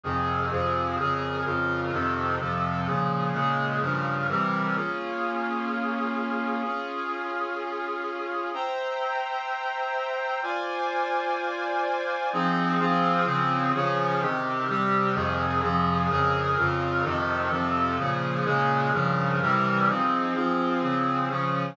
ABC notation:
X:1
M:4/4
L:1/8
Q:1/4=127
K:Fm
V:1 name="Brass Section"
[F,,C,E,A]2 [F,,C,F,A]2 | [F,,D,AB]2 [F,,D,FB]2 [F,,C,E,=A]2 [F,,C,F,A]2 | [B,,D,F,A]2 [B,,D,A,A]2 [G,,D,F,B]2 [C,=E,G,B]2 | [K:Bbm] [B,DFA]8 |
[DFA]8 | [c=e=gb]8 | [Fc=da]8 | [K:Fm] [F,CEA]2 [F,CFA]2 [D,F,CA]2 [D,F,DA]2 |
[C,E,G]2 [C,G,G]2 [F,,C,E,A]2 [F,,C,F,A]2 | [F,,D,AB]2 [F,,D,FB]2 [F,,C,E,=A]2 [F,,C,F,A]2 | [B,,D,F,A]2 [B,,D,A,A]2 [G,,D,F,B]2 [C,=E,G,B]2 | [F,CEA]2 [F,CFA]2 [D,F,CA]2 [D,F,DA]2 |]